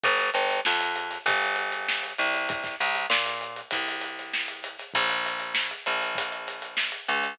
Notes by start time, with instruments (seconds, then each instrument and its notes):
0.03 electric bass (finger) G1, kick, closed hi-hat
0.18 snare, closed hi-hat
0.34 electric bass (finger) G1, closed hi-hat
0.49 snare, closed hi-hat
0.65 electric bass (finger) F2, snare
0.81 closed hi-hat
0.96 closed hi-hat
1.11 snare, closed hi-hat
1.26 electric bass (finger) G1, kick, closed hi-hat
1.42 closed hi-hat
1.56 closed hi-hat
1.72 snare, closed hi-hat
1.88 snare
2.03 closed hi-hat
2.18 electric bass (finger) C2, closed hi-hat
2.34 snare, closed hi-hat
2.49 kick, closed hi-hat
2.64 kick, snare, closed hi-hat
2.80 electric bass (finger) C2, closed hi-hat
2.95 closed hi-hat
3.10 electric bass (finger) A#2, snare
3.26 closed hi-hat
3.41 closed hi-hat
3.56 closed hi-hat
3.71 electric bass (finger) C2, kick, closed hi-hat
3.88 closed hi-hat
4.02 closed hi-hat
4.19 snare, closed hi-hat
4.34 snare
4.48 closed hi-hat
4.63 snare, closed hi-hat
4.79 snare, closed hi-hat
4.94 electric bass (finger) A#1, kick, closed hi-hat
5.10 snare, closed hi-hat
5.26 closed hi-hat
5.40 closed hi-hat
5.55 snare
5.71 closed hi-hat
5.86 electric bass (finger) A#1, closed hi-hat
6.02 closed hi-hat
6.15 kick, closed hi-hat
6.32 closed hi-hat
6.46 snare, closed hi-hat
6.62 closed hi-hat
6.77 snare
6.92 closed hi-hat
7.08 electric bass (finger) C#2, closed hi-hat
7.24 closed hi-hat